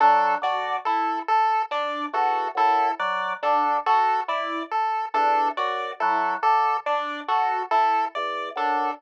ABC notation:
X:1
M:7/8
L:1/8
Q:1/4=70
K:none
V:1 name="Drawbar Organ" clef=bass
_G, D, z3 E,, _G,, | _G, D, z3 E,, _G,, | _G, D, z3 E,, _G,, |]
V:2 name="Electric Piano 1"
D _G E z D G E | z D _G E z D G | E z D _G E z D |]
V:3 name="Lead 1 (square)"
A d A A d A A | d A A d A A d | A A d A A d A |]